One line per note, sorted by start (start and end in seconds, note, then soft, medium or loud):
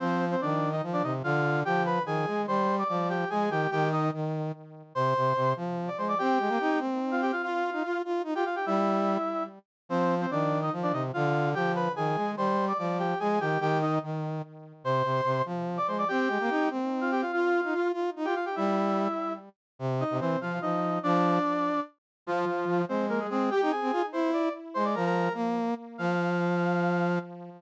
0.00 0.36 F3 medium
0.00 0.25 C4 loud
0.00 0.25 C5 loud
0.31 0.41 C4 medium
0.31 0.41 C5 loud
0.41 0.81 D#3 medium
0.41 0.69 D4 medium
0.41 0.69 D5 loud
0.72 0.82 D#4 medium
0.72 0.82 D#5 loud
0.83 1.02 F3 medium
0.93 1.03 D4 medium
0.93 1.03 D5 loud
1.03 1.22 C3 medium
1.03 1.13 D#4 medium
1.03 1.13 D#5 medium
1.24 1.63 D3 medium
1.24 1.60 F4 loud
1.24 1.60 F5 loud
1.65 1.99 F3 medium
1.65 1.82 G4 loud
1.65 1.82 G5 loud
1.86 2.02 B4 medium
1.86 2.02 B5 loud
2.05 2.26 D#3 medium
2.05 2.41 G#4 medium
2.05 2.41 G#5 loud
2.27 2.46 G#3 medium
2.47 2.83 G3 medium
2.47 2.75 C5 medium
2.47 2.75 C6 loud
2.78 2.88 D5 medium
2.78 2.88 D6 loud
2.89 3.24 F3 medium
2.89 3.08 D5 medium
2.89 3.08 D6 loud
3.09 3.29 G4 medium
3.09 3.29 G5 medium
3.30 3.49 G#3 medium
3.30 3.50 G#4 medium
3.30 3.50 G#5 loud
3.50 3.67 D#3 medium
3.50 3.70 G4 loud
3.50 3.70 G5 loud
3.71 4.10 D#3 medium
3.71 3.88 G4 loud
3.71 3.88 G5 loud
3.92 4.09 D#4 medium
3.92 4.09 D#5 loud
4.13 4.52 D#3 medium
4.95 5.14 C3 medium
4.95 5.52 C5 loud
4.95 5.52 C6 loud
5.16 5.33 C3 medium
5.36 5.54 C3 medium
5.56 5.89 F3 medium
5.88 5.98 D5 medium
5.88 5.98 D6 loud
5.98 6.15 G#3 medium
5.98 6.08 C5 medium
5.98 6.08 C6 medium
6.08 6.18 D5 medium
6.08 6.18 D6 loud
6.18 6.38 C4 medium
6.18 6.78 G4 loud
6.18 6.78 G5 loud
6.39 6.49 G#3 medium
6.48 6.58 A#3 medium
6.60 6.80 D#4 medium
6.79 7.32 C4 medium
7.11 7.21 F4 medium
7.11 7.21 F5 medium
7.22 7.31 G4 loud
7.22 7.31 G5 loud
7.32 7.42 F4 medium
7.32 7.42 F5 loud
7.42 7.98 F4 medium
7.42 7.70 F4 medium
7.42 7.98 F5 loud
7.73 7.83 D#4 medium
7.84 8.02 F4 medium
8.05 8.22 F4 medium
8.24 8.34 D#4 medium
8.34 8.44 F4 medium
8.34 8.45 G4 medium
8.34 8.45 G5 loud
8.45 8.55 F4 medium
8.45 8.55 F5 loud
8.56 8.65 G4 medium
8.56 8.65 G5 medium
8.66 9.17 G3 medium
8.66 9.43 E4 medium
8.66 9.43 E5 loud
9.89 10.26 F3 medium
9.89 10.15 C4 loud
9.89 10.15 C5 loud
10.21 10.30 C4 medium
10.21 10.30 C5 loud
10.31 10.70 D#3 medium
10.31 10.59 D4 medium
10.31 10.59 D5 loud
10.62 10.72 D#4 medium
10.62 10.72 D#5 loud
10.72 10.92 F3 medium
10.83 10.92 D4 medium
10.83 10.92 D5 loud
10.92 11.12 C3 medium
10.92 11.03 D#4 medium
10.92 11.03 D#5 medium
11.13 11.54 D3 medium
11.13 11.50 F4 loud
11.13 11.50 F5 loud
11.55 11.88 F3 medium
11.55 11.72 G4 loud
11.55 11.72 G5 loud
11.75 11.92 B4 medium
11.75 11.92 B5 loud
11.96 12.16 D#3 medium
11.96 12.31 G#4 medium
11.96 12.31 G#5 loud
12.16 12.35 G#3 medium
12.36 12.73 G3 medium
12.36 12.65 C5 medium
12.36 12.65 C6 loud
12.68 12.78 D5 medium
12.68 12.78 D6 loud
12.78 13.14 F3 medium
12.78 12.98 D5 medium
12.78 12.98 D6 loud
12.99 13.18 G4 medium
12.99 13.18 G5 medium
13.20 13.39 G#3 medium
13.20 13.40 G#4 medium
13.20 13.40 G#5 loud
13.40 13.58 D#3 medium
13.40 13.59 G4 loud
13.40 13.59 G5 loud
13.60 13.99 D#3 medium
13.60 13.78 G4 loud
13.60 13.78 G5 loud
13.81 13.98 D#4 medium
13.81 13.98 D#5 loud
14.03 14.42 D#3 medium
14.84 15.02 C3 medium
14.84 15.42 C5 loud
14.84 15.42 C6 loud
15.04 15.21 C3 medium
15.25 15.42 C3 medium
15.45 15.79 F3 medium
15.77 15.87 D5 medium
15.77 15.87 D6 loud
15.87 16.04 G#3 medium
15.87 15.97 C5 medium
15.87 15.97 C6 medium
15.98 16.08 D5 medium
15.98 16.08 D6 loud
16.08 16.29 C4 medium
16.08 16.68 G4 loud
16.08 16.68 G5 loud
16.28 16.38 G#3 medium
16.40 16.50 A#3 medium
16.50 16.69 D#4 medium
16.70 17.23 C4 medium
17.01 17.11 F4 medium
17.01 17.11 F5 medium
17.11 17.21 G4 loud
17.11 17.21 G5 loud
17.22 17.31 F4 medium
17.22 17.31 F5 loud
17.32 17.88 F4 medium
17.32 17.61 F4 medium
17.32 17.88 F5 loud
17.64 17.74 D#4 medium
17.73 17.92 F4 medium
17.93 18.10 F4 medium
18.16 18.26 D#4 medium
18.25 18.35 F4 medium
18.25 18.34 G4 medium
18.25 18.34 G5 loud
18.35 18.45 F4 medium
18.35 18.45 F5 loud
18.45 18.55 G4 medium
18.45 18.55 G5 medium
18.56 19.08 G3 medium
18.56 19.33 E4 medium
18.56 19.33 E5 loud
19.79 20.04 C3 medium
20.00 20.17 D#4 medium
20.00 20.17 D#5 loud
20.10 20.20 C3 medium
20.19 20.36 E3 medium
20.19 20.39 C4 medium
20.19 20.39 C5 loud
20.41 20.59 F3 medium
20.41 20.60 F4 medium
20.41 20.60 F5 medium
20.62 20.99 F3 medium
20.62 20.99 D#4 medium
20.62 20.99 D#5 medium
21.03 21.39 F3 medium
21.03 21.80 D4 loud
21.03 21.80 D5 loud
22.26 22.45 F3 medium
22.26 22.82 F3 loud
22.26 22.82 F4 loud
22.47 22.65 F3 medium
22.68 22.85 F3 medium
22.88 23.27 G#3 medium
22.88 23.05 C4 medium
22.88 23.05 C5 loud
23.09 23.19 A#3 medium
23.09 23.19 A#4 loud
23.20 23.29 G#3 medium
23.20 23.29 G#4 medium
23.30 23.50 G#3 medium
23.30 23.50 C4 medium
23.30 23.50 G#4 loud
23.51 23.70 G4 loud
23.51 23.61 G4 medium
23.51 23.70 G5 loud
23.62 23.72 D#4 medium
23.71 24.06 G#4 medium
23.71 24.06 G#5 medium
23.82 23.91 C4 medium
23.92 24.02 F4 medium
24.12 24.49 E4 medium
24.12 24.30 C5 medium
24.12 24.30 C6 medium
24.33 24.53 D5 medium
24.33 24.53 D6 loud
24.74 24.95 G#3 medium
24.74 24.84 C5 loud
24.74 24.84 C6 loud
24.84 24.94 D5 medium
24.84 24.94 D6 loud
24.95 25.29 F3 medium
24.95 25.05 A#4 medium
24.95 25.05 A#5 loud
25.05 25.33 A#4 loud
25.05 25.33 A#5 loud
25.34 25.74 A#3 medium
25.98 27.19 F3 loud
25.98 27.18 F5 loud